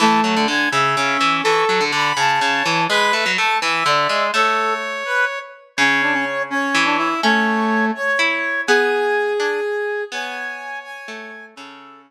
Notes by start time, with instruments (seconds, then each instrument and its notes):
0.00 harpsichord E3, brass section A3 A5
0.24 harpsichord F#3
0.36 harpsichord D3
0.48 harpsichord D3, brass section G#5
0.71 harpsichord C#3, brass section E5
0.96 harpsichord C#3, brass section C#4
1.21 harpsichord E3
1.43 harpsichord E3, brass section A4 C#6
1.69 harpsichord F#3
1.81 harpsichord D3
1.92 harpsichord D3, brass section B5
2.17 harpsichord C#3, brass section A5
2.40 harpsichord C#3, brass section C#5
2.66 harpsichord E3
2.90 harpsichord G#3, brass section B4 B5
3.13 harpsichord A3
3.26 harpsichord F#3
3.38 harpsichord A3, brass section A5
3.61 harpsichord E3, brass section E5
3.86 harpsichord D3, brass section D5
4.09 harpsichord G#3
4.34 harpsichord A3, brass section A4 C#5
5.05 brass section B4
5.77 harpsichord C#3, brass section C#4 C#5
6.02 brass section D4
6.13 brass section C#4
6.50 brass section C#4 C#5
6.74 harpsichord E3
6.85 brass section D4
6.98 brass section E4
7.23 brass section A3 C#5, harpsichord C#4
7.95 brass section C#5
8.19 harpsichord E4
8.67 harpsichord B3, brass section G#4 G#5
9.39 harpsichord D4, brass section G#5
10.12 harpsichord B3, brass section C#5 G#5
10.84 brass section G#5
11.08 harpsichord A3
11.55 harpsichord C#3, brass section C#4 A4